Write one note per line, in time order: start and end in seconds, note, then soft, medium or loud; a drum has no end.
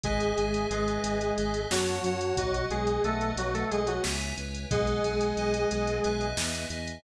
0.03 0.32 G#1 loud
0.03 0.66 G#3 medium
0.03 0.66 G#4 medium
0.03 0.35 B4 loud
0.03 0.35 D#5 loud
0.03 0.35 E5 loud
0.03 0.35 G#5 loud
0.03 kick loud
0.03 closed hi-hat medium
0.20 closed hi-hat medium
0.37 0.66 G#1 medium
0.37 0.68 B4 medium
0.37 0.68 D#5 medium
0.37 0.68 E5 medium
0.37 0.68 G#5 loud
0.37 closed hi-hat medium
0.54 closed hi-hat medium
0.70 0.98 G#1 medium
0.70 1.60 G#3 medium
0.70 1.60 G#4 medium
0.70 1.32 B4 loud
0.70 1.32 D#5 loud
0.70 1.32 E5 medium
0.70 1.32 G#5 loud
0.70 closed hi-hat medium
0.88 closed hi-hat medium
1.04 1.32 G#1 medium
1.04 closed hi-hat medium
1.21 closed hi-hat medium
1.38 1.66 G#1 medium
1.38 1.68 B4 medium
1.38 1.68 D#5 loud
1.38 1.68 E5 loud
1.38 1.68 G#5 medium
1.38 closed hi-hat medium
1.54 closed hi-hat medium
1.70 1.99 F#2 loud
1.70 2.34 F#3 medium
1.70 2.34 F#4 medium
1.70 2.01 C#5 loud
1.70 2.01 F#5 loud
1.70 2.01 A5 loud
1.70 snare loud
1.87 closed hi-hat medium
2.04 2.33 F#2 medium
2.04 2.35 C#5 medium
2.04 2.35 F#5 loud
2.04 2.35 A5 loud
2.04 closed hi-hat medium
2.21 closed hi-hat medium
2.37 2.66 B1 medium
2.37 2.65 F#3 medium
2.37 2.65 F#4 medium
2.37 2.68 B4 loud
2.37 2.68 D#5 loud
2.37 2.68 F#5 loud
2.37 kick loud
2.37 closed hi-hat loud
2.54 closed hi-hat medium
2.70 2.99 B1 loud
2.70 3.02 G#3 medium
2.70 3.02 G#4 medium
2.70 3.01 B4 loud
2.70 3.01 D#5 medium
2.70 3.01 F#5 medium
2.70 closed hi-hat medium
2.87 closed hi-hat medium
3.04 3.33 B1 medium
3.04 3.31 A3 medium
3.04 3.31 A4 medium
3.04 3.65 B4 loud
3.04 3.65 D#5 medium
3.04 3.65 F#5 medium
3.04 closed hi-hat medium
3.21 closed hi-hat medium
3.36 3.64 B1 medium
3.36 3.53 F#3 medium
3.36 3.53 F#4 medium
3.36 closed hi-hat medium
3.54 3.70 A3 medium
3.54 3.70 A4 medium
3.54 closed hi-hat medium
3.71 3.99 B1 medium
3.71 3.87 G#3 medium
3.71 3.87 G#4 medium
3.71 4.01 B4 medium
3.71 4.01 D#5 medium
3.71 4.01 F#5 loud
3.71 closed hi-hat medium
3.87 4.03 F#3 medium
3.87 4.03 F#4 medium
3.87 closed hi-hat medium
4.04 4.33 C#2 loud
4.04 4.34 B4 loud
4.04 4.34 C#5 loud
4.04 4.34 E5 loud
4.04 4.34 G#5 loud
4.04 snare loud
4.21 closed hi-hat medium
4.37 4.66 C#2 medium
4.37 4.68 B4 loud
4.37 4.68 C#5 medium
4.37 4.68 E5 medium
4.37 4.68 G#5 loud
4.37 closed hi-hat medium
4.54 closed hi-hat medium
4.70 4.99 B1 loud
4.70 6.26 G#3 medium
4.70 6.26 G#4 medium
4.70 5.01 B4 loud
4.70 5.01 D#5 loud
4.70 5.01 F#5 loud
4.70 5.01 G#5 loud
4.70 kick loud
4.70 closed hi-hat medium
4.87 closed hi-hat medium
5.04 5.33 B1 medium
5.04 5.35 B4 medium
5.04 5.35 D#5 medium
5.04 5.35 F#5 loud
5.04 5.35 G#5 loud
5.04 closed hi-hat medium
5.21 closed hi-hat medium
5.37 5.65 B1 medium
5.37 5.99 B4 medium
5.37 5.99 D#5 loud
5.37 5.99 F#5 loud
5.37 5.99 G#5 loud
5.37 closed hi-hat medium
5.54 closed hi-hat medium
5.71 6.00 B1 medium
5.71 closed hi-hat medium
5.87 closed hi-hat medium
6.03 6.34 B1 medium
6.03 6.67 B4 loud
6.03 6.67 D#5 loud
6.03 6.67 E5 loud
6.03 6.67 G#5 loud
6.03 closed hi-hat medium
6.21 closed hi-hat medium
6.37 6.65 E2 loud
6.37 snare loud
6.55 closed hi-hat medium
6.70 6.98 E2 loud
6.70 7.01 B4 medium
6.70 7.01 D#5 loud
6.70 7.01 E5 medium
6.70 7.01 G#5 medium
6.70 closed hi-hat medium
6.87 closed hi-hat medium